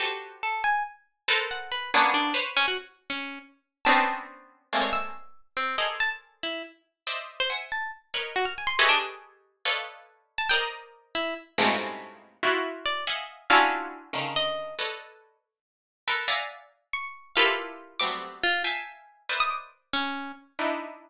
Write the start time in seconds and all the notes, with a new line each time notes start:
0.00 F#4 G4 A4 B4 C5
0.43 A4
0.64 G#5
1.28 A4 A#4 B4 C5
1.51 F#5
1.72 B4
1.94 A#3 B3 C#4 D4
2.14 D4
2.34 B4 C5 C#5
2.57 C#4
2.68 F#4
3.10 C#4
3.85 B3 C4 C#4 D4 A5
4.73 G3 G#3 A3 A#3 C4
4.82 C#5
4.93 E6
5.57 C4
5.78 G#4 A4 A#4 C5 D5 D#5
6.00 A5
6.43 E4
7.07 C5 D5 D#5 E5
7.40 C5
7.50 E5 F#5 G#5
7.72 A5
8.14 A#4 B4 C#5 D#5 F#6
8.36 F#4
8.45 F6
8.58 G#5
8.67 C6
8.79 G4 G#4 A4 B4 C#5 D#5 E5
8.89 D4
9.65 A4 B4 C#5 D5 D#5 F5
10.38 A5
10.49 A#4 C5 D5 D#5 G5
11.15 E4
11.58 G2 G#2 A2 B2 C3 C#3
12.43 E4 F4 F#4
12.86 D5
13.07 D#5 E5 F5 F#5 G#5
13.50 C#4 D4 E4 F4 F#4 F5
14.13 C#3 D3 D#3
14.36 D#5
14.79 A4 B4 C#5 D5 D#5
16.08 A4 A#4 B4
16.28 D5 E5 F5 F#5 G#5 A#5
16.93 C#6
17.36 E4 F4 G4 A4 A#4 B4 F5
18.00 F#3 G3 A3 B3 C4 D6
18.43 F4
18.64 E5 F5 G5 G#5 A5
19.29 A#4 B4 C5 D5 D#5 E5
19.40 D#6
19.50 D6
19.93 C#4
20.59 D4 D#4 E4